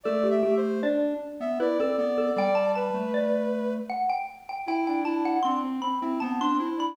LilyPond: <<
  \new Staff \with { instrumentName = "Xylophone" } { \time 3/4 \key g \major \tempo 4 = 78 a'16 g'16 g'8 d''4 b'16 a'16 r16 a'16 | g''16 a''16 a''8 d''4 fis''16 g''16 r16 g''16 | g''16 g''16 a''16 fis''16 c'''8 b''8 a''16 c'''8 b''16 | }
  \new Staff \with { instrumentName = "Ocarina" } { \time 3/4 \key g \major \tuplet 3/2 { d''8 e''8 c''8 } r8. e''16 d''16 d''16 d''8 | d''8 b'4. r4 | e'16 d'16 d'8 d'16 c'16 c'16 e'16 c'8. d'16 | }
  \new Staff \with { instrumentName = "Lead 1 (square)" } { \time 3/4 \key g \major a8 a8 d'8 r16 b16 e'16 c'16 b8 | g8. a4~ a16 r4 | e'8 e'8 c'8 r16 c'16 b16 d'16 e'8 | }
>>